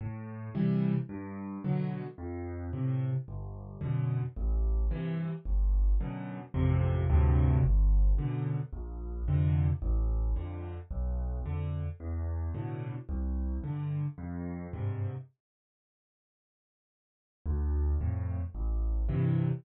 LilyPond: \new Staff { \clef bass \time 4/4 \key a \minor \tempo 4 = 110 a,4 <c e g>4 g,4 <b, d fis>4 | f,4 <a, c>4 g,,4 <fis, b, d>4 | a,,4 <g, c e>4 g,,4 <fis, b, d>4 | <a,, f, c>4 <d, g, a, c>4 g,,4 <fis, b, d>4 |
bes,,4 <f, c d>4 a,,4 <f, d>4 | b,,4 <f, d>4 e,4 <a, b, d>4 | c,4 <g, d>4 f,4 <g, aes, c>4 | r1 |
d,4 <f, a,>4 a,,4 <g, c e>4 | }